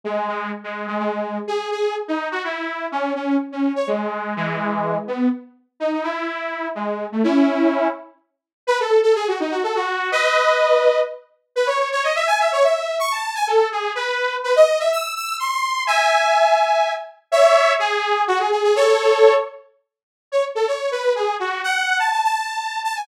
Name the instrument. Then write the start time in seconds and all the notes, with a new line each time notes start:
lead 2 (sawtooth)
0.04 G#3
0.28 G#3
0.64 G#3
0.87 G#3
0.99 G#3
1.47 G#4
1.71 G#4
2.08 D#4
2.31 F#4
2.44 E4
2.92 C#4
3.15 C#4
3.52 C#4
3.76 C#5
3.87 G#3
4.36 E3 G#3
5.08 B3
5.80 D#4
5.92 D#4
6.03 E4
6.75 G#3
7.12 A3
7.24 C#4 E4
8.67 B4
8.80 A4
9.03 A4
9.15 G#4
9.28 F#4
9.40 D#4
9.51 F#4
9.63 A4
9.75 F#4
10.12 B4 D#5
11.56 B4
11.67 C#5
11.92 C#5
12.04 D#5
12.15 E5
12.27 G#5
12.40 E5
12.52 C#5
12.63 E5
12.99 C#6
13.12 A5
13.35 G#5
13.47 A4
13.72 G#4
13.95 B4
14.44 B4
14.56 D#5
14.79 E5
14.92 E6
15.16 E6
15.39 C6
15.87 E5 G#5
17.32 C#5 E5
17.79 G#4
18.28 F#4
18.39 G#4
18.52 G#4
18.64 G#4
18.76 A4 C#5
20.32 C#5
20.55 A4
20.67 C#5
20.91 B4
21.15 G#4
21.39 F#4
21.64 F#5
21.99 A5
22.11 A5
22.24 A5
22.84 A5
22.96 G#5